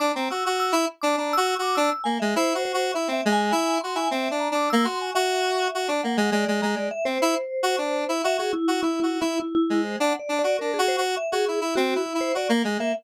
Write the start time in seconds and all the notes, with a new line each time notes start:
0.00 D4 D6
0.14 C4 A#5
0.31 F#4 E6
0.46 F#4
0.60 E6
0.72 E4
1.01 D4 D6
1.17 D4 A#5
1.33 F#4 E6
1.47 E6
1.59 F#4 D6
1.75 D4 E6
2.04 A#3 G#5
2.20 G#3 E5
2.36 E4 C5
2.55 F#4
2.65 C5
2.74 F#4
2.94 E4 E5
3.08 C4
3.13 E5
3.25 G#3
3.32 G#5
3.51 E4 G#5
3.81 F#4 C6
3.95 E4 G#5
4.11 C4 E5
4.31 D4
4.40 A#5
4.51 D4 D6
4.70 A#3 E6
4.84 F#4 C6
5.01 G#5
5.15 F#4 E5
5.75 F#4
5.88 D4 D5
6.03 A#3 F#5
6.17 G#3
6.32 G#3 D5
6.48 G#3
6.62 G#3 A#5
6.76 G#3 D5
6.91 E5
7.05 C4 C5
7.22 E4
7.63 F#4
7.78 D4
8.09 E4
8.24 F#4 E5
8.38 F#4 G#4
8.53 E4
8.68 F#4
8.83 E4
9.00 E4 F#4
9.21 E4
9.40 E4
9.55 E4
9.70 G#3
9.84 C5
10.00 D4 F#5
10.19 D5
10.29 D4
10.39 D5
10.44 F#4
10.59 D4 A#4
10.74 G#4
10.79 F#4
10.88 C5
10.98 F#4
11.17 E5
11.32 F#4 G#4
11.48 E4
11.61 E4
11.75 C4 F#4
11.95 E4
12.06 E4
12.15 E4
12.21 C5
12.35 F#4 D5
12.49 A#3
12.64 G#3
12.79 A#3 E5